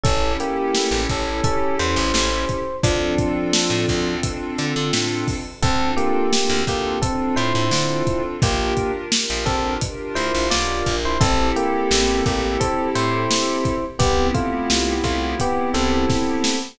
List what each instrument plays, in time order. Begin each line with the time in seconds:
0.03 electric bass (finger) A1, electric piano 1 C#4 A4, pad 2 (warm) C#4 E4 G4 A4, kick, closed hi-hat
0.40 electric piano 1 A#3 G4, closed hi-hat
0.75 snare
0.91 electric bass (finger) A1
1.09 electric bass (finger) A1, electric piano 1 C#4 A4, kick, closed hi-hat
1.44 electric piano 1 C#4 A4, kick, closed hi-hat
1.79 electric bass (finger) E2, electric piano 1 C5, closed hi-hat
1.96 electric bass (finger) A1
2.14 electric bass (finger) A1, snare
2.49 kick, closed hi-hat
2.83 electric bass (finger) D2, electric piano 1 F3 D4, pad 2 (warm) C4 D4 F4 A4, kick, closed hi-hat
3.18 kick, closed hi-hat
3.53 snare
3.70 electric bass (finger) A2
3.89 electric bass (finger) D2, kick, closed hi-hat
4.23 kick, closed hi-hat
4.58 electric bass (finger) D3, closed hi-hat
4.76 electric bass (finger) D3
4.93 electric bass (finger) A2, snare
5.28 kick, open hi-hat
5.62 electric bass (finger) D2, electric piano 1 C4 A4, pad 2 (warm) C4 D4 F4 A4, kick, closed hi-hat
5.97 electric piano 1 A#3 G4, closed hi-hat
6.33 pad 2 (warm) C4 D4 F4 A4, snare
6.50 electric bass (finger) D2
6.67 electric bass (finger) D2, electric piano 1 A#3 G4, kick, closed hi-hat
7.02 electric piano 1 C4 A4, pad 2 (warm) C4 D4 F4 A4, kick, closed hi-hat
7.36 electric bass (finger) A2, electric piano 1 E4 C5, closed hi-hat
7.55 electric bass (finger) A2
7.71 electric bass (finger) D3, pad 2 (warm) C4 D4 F4 A4, snare
8.07 kick, closed hi-hat
8.42 electric bass (finger) A#1, electric piano 1 A#3 G4, pad 2 (warm) D4 F4 G4 A#4, kick, closed hi-hat
8.77 kick, closed hi-hat
9.12 pad 2 (warm) D4 F4 G4 A#4, snare
9.30 electric bass (finger) A#1
9.46 electric bass (finger) A#1, electric piano 1 C4 A4, kick, closed hi-hat
9.81 pad 2 (warm) D4 F4 G4 A#4, kick, closed hi-hat
10.15 electric bass (finger) D2, electric piano 1 E4 C5, closed hi-hat
10.35 electric bass (finger) A#1
10.50 electric bass (finger) B1, pad 2 (warm) D4 F4 G4 A#4, electric piano 1 F4 D5, snare
10.86 electric bass (finger) A#1, kick, closed hi-hat
11.05 electric piano 1 E4 C5
11.20 electric bass (finger) A1, electric piano 1 C4 A4, pad 2 (warm) C4 E4 G4 A4, kick, closed hi-hat
11.56 electric piano 1 A#3 G4, closed hi-hat
11.91 electric bass (finger) A1, snare
12.26 electric bass (finger) A1, electric piano 1 A#3 G4, kick, closed hi-hat
12.60 electric piano 1 C4 A4, kick, closed hi-hat
12.95 electric bass (finger) A2, electric piano 1 E4 C5, closed hi-hat
13.31 snare
13.65 kick, closed hi-hat
13.99 electric bass (finger) C2, electric piano 1 B3 G4, pad 2 (warm) B3 C4 E4 G4, kick, closed hi-hat
14.34 electric piano 1 A3 F4, kick, closed hi-hat
14.70 electric bass (finger) C2, snare
15.04 electric bass (finger) C2, electric piano 1 A3 F4, kick, closed hi-hat
15.40 electric piano 1 B3 G4, kick, closed hi-hat
15.74 electric bass (finger) C2, electric piano 1 C4 A4, closed hi-hat
16.10 kick, snare
16.44 snare